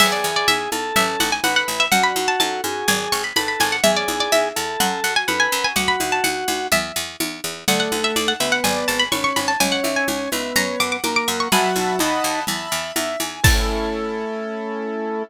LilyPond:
<<
  \new Staff \with { instrumentName = "Harpsichord" } { \time 4/4 \key a \major \tempo 4 = 125 e''16 d''8 d''16 e''4 e''8 fis''16 gis''16 fis''16 fis''16 r16 e''16 | fis''16 b''8 a''16 a''4 gis''8 cis'''16 b''16 b''16 b''16 gis''16 fis''16 | e''16 d''8 d''16 e''4 fis''8 fis''16 gis''16 fis''16 gis''16 r16 gis''16 | fis''16 b''8 a''16 fis''4 e''4 r4 |
fis''16 fis''8 e''16 d''16 fis''16 e''16 fis''16 gis''8 a''16 b''16 cis'''16 cis'''16 b''16 a''16 | gis''16 fis''8 gis''16 r4 ais''8 d'''16 d'''16 d'''16 d'''16 cis'''16 cis'''16 | <gis'' b''>2 r2 | a''1 | }
  \new Staff \with { instrumentName = "Drawbar Organ" } { \time 4/4 \key a \major gis'4. a'4. b'4 | fis'4. gis'4. a'4 | gis'4. a'4. b'4 | fis'2 r2 |
a4. b4. cis'4 | cis'4. b4. ais4 | fis4 dis'4 r2 | a1 | }
  \new Staff \with { instrumentName = "Acoustic Grand Piano" } { \time 4/4 \key a \major b8 e'8 gis'8 e'8 cis'8 e'8 a'8 e'8 | d'8 fis'8 a'8 fis'8 d'8 gis'8 b'8 gis'8 | cis'8 e'8 gis'8 e'8 cis'8 fis'8 a'8 fis'8 | r1 |
d''8 fis''8 a''8 fis''8 d''8 gis''8 b''8 gis''8 | cis''8 e''8 gis''8 e''8 cis''8 fis''8 ais''8 fis''8 | <e'' fis'' a'' b''>4 <dis'' fis'' a'' b''>4 <e'' a'' b''>4 e''8 gis''8 | <cis' e' a'>1 | }
  \new Staff \with { instrumentName = "Harpsichord" } { \clef bass \time 4/4 \key a \major e,8 e,8 e,8 e,8 a,,8 a,,8 a,,8 a,,8 | fis,8 fis,8 fis,8 fis,8 gis,,8 gis,,8 gis,,8 gis,,8 | e,8 e,8 e,8 e,8 fis,8 fis,8 fis,8 fis,8 | d,8 d,8 d,8 d,8 e,8 e,8 e,8 e,8 |
d,8 d,8 d,8 d,8 gis,,8 gis,,8 gis,,8 gis,,8 | cis,8 cis,8 cis,8 cis,8 fis,8 fis,8 fis,8 fis,8 | b,,8 b,,8 dis,8 dis,8 e,8 e,8 e,8 e,8 | a,1 | }
  \new DrumStaff \with { instrumentName = "Drums" } \drummode { \time 4/4 <cgl cymc>4 cgho8 cgho8 cgl8 cgho8 cgho4 | cgl8 cgho8 cgho8 cgho8 cgl4 cgho8 cgho8 | cgl8 cgho8 cgho4 cgl4 cgho4 | cgl8 cgho8 cgho8 cgho8 cgl4 cgho4 |
cgl8 cgho8 cgho4 cgl4 cgho8 cgho8 | cgl8 cgho8 cgho8 cgho8 cgl4 cgho4 | cgl8 cgho8 cgho4 cgl4 cgho8 cgho8 | <cymc bd>4 r4 r4 r4 | }
>>